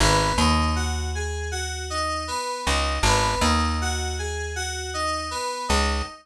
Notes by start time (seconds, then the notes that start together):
0.00 G#1 B3
0.38 D#2 D#4
0.76 F#4
1.15 G#4
1.51 F#4
1.90 D#4
2.28 B3
2.66 C#2 D#4
3.03 G#1 B3
3.41 D#2 D#4
3.81 F#4
4.19 G#4
4.56 F#4
4.94 D#4
5.31 B3
5.68 C#2 D#4